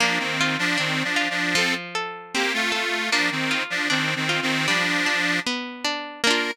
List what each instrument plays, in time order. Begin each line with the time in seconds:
0.00 accordion F3 D4, pizzicato strings A#3
0.19 accordion D#3 C4
0.41 pizzicato strings F4
0.59 accordion F3 D4
0.78 accordion D#3 C4, pizzicato strings D4
1.04 accordion F3 D4
1.16 pizzicato strings F4
1.30 accordion F3 D4
1.55 pizzicato strings F3, accordion C4 A4
1.95 pizzicato strings A4
2.34 accordion A#3 G4, pizzicato strings C4
2.54 accordion A3 F4
2.72 accordion A3 F4, pizzicato strings A4
3.11 accordion F3 D4, pizzicato strings A#3
3.31 accordion D#3 C4
3.51 pizzicato strings F4
3.70 accordion F3 D4
3.90 accordion D#3 C4, pizzicato strings D4
4.16 accordion D#3 C4
4.29 pizzicato strings F4
4.42 accordion D#3 C4
4.67 accordion F3 D4, pizzicato strings G3
5.06 pizzicato strings D4
5.47 pizzicato strings B3
5.84 pizzicato strings D4
6.24 pizzicato strings A#3 D4, accordion A#4
6.31 pizzicato strings F4